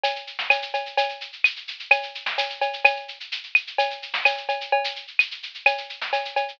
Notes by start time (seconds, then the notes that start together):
0.04 cowbell, shaker
0.16 shaker
0.27 shaker
0.39 snare, shaker
0.50 cowbell, claves, shaker
0.62 shaker
0.74 cowbell, shaker
0.86 shaker
0.97 cowbell, shaker
1.09 shaker
1.21 shaker
1.33 shaker
1.44 claves, shaker
1.56 shaker
1.68 shaker
1.79 shaker
1.91 cowbell, claves, shaker
2.03 shaker
2.15 shaker
2.26 snare, shaker
2.38 cowbell, shaker
2.50 shaker
2.61 cowbell, shaker
2.73 shaker
2.85 cowbell, claves, shaker
2.96 shaker
3.08 shaker
3.20 shaker
3.32 shaker
3.43 shaker
3.55 claves, shaker
3.67 shaker
3.78 cowbell, shaker
3.90 shaker
4.02 shaker
4.14 snare, shaker
4.25 cowbell, claves, shaker
4.37 shaker
4.49 cowbell, shaker
4.61 shaker
4.72 cowbell
4.84 shaker
4.96 shaker
5.07 shaker
5.19 claves, shaker
5.31 shaker
5.43 shaker
5.54 shaker
5.66 cowbell, claves, shaker
5.78 shaker
5.89 shaker
6.01 snare, shaker
6.13 cowbell, shaker
6.25 shaker
6.36 cowbell, shaker
6.48 shaker